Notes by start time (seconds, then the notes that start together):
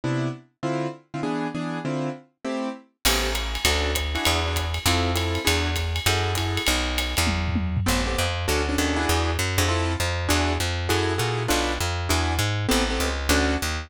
0.04 C3 B3 D4 E4
0.63 D3 C4 E4 F4
1.14 D3 C4 E4 F4
1.23 E3 B3 D4 G#4
1.55 E3 B3 D4 G#4
1.85 D3 C4 E4 F4
2.45 A3 C4 E4 G4
3.05 A1 B3 C4 G4 A4, crash, ride
3.35 hi-hat pedal, ride
3.55 ride
3.65 D2 C#4 D4 F#4 A4, kick, ride
3.95 kick, hi-hat pedal, ride
4.15 D4 E4 F#4 G#4, ride
4.25 E2, ride
4.47 D4 E4 F#4 G#4
4.56 kick, hi-hat pedal, ride
4.74 ride
4.86 F2 C4 E4 F4 A4, kick, ride
5.15 C4 E4 F4 A4, hi-hat pedal, ride
5.35 ride
5.45 E2 D4 E4 F#4 G#4, ride
5.76 kick, hi-hat pedal, ride
5.96 ride
6.06 F#2 E4 F#4 G#4 A4, kick, ride
6.35 E4 F#4 G#4 A4, kick, hi-hat pedal, ride
6.57 ride
6.67 B1, ride
6.98 hi-hat pedal, ride
7.17 E2, ride
7.27 kick, high tom
7.48 floor tom
7.56 high tom
7.77 floor tom
7.86 A1 B3 C4 G4 A4
8.06 B3 C4 G4 A4
8.18 F2
8.48 D2 C#4 D4 F#4 A4
8.69 C#4 D4 F#4 A4
8.78 D#2 C#4 D4 F#4 A4
8.96 D4 E4 F#4 G#4
9.09 E2
9.39 F#2
9.58 F2 D4 E4 F#4 G#4
9.68 C4 E4 F4 A4
10.00 F2
10.29 E2 D4 E4 F#4 G#4
10.60 F2
10.89 F#2 E4 F#4 G#4 A4
11.18 A#2 E4 F#4 G#4 A4
11.48 B1 D4 F4 A4 B4
11.80 F2
12.09 E2 D4 E4 F#4 G#4
12.39 G#2
12.69 A1 B3 C4 G4 A4
12.90 B3 C4 G4 A4
13.00 C#2
13.29 D2 C#4 D4 F#4 A4
13.62 D#2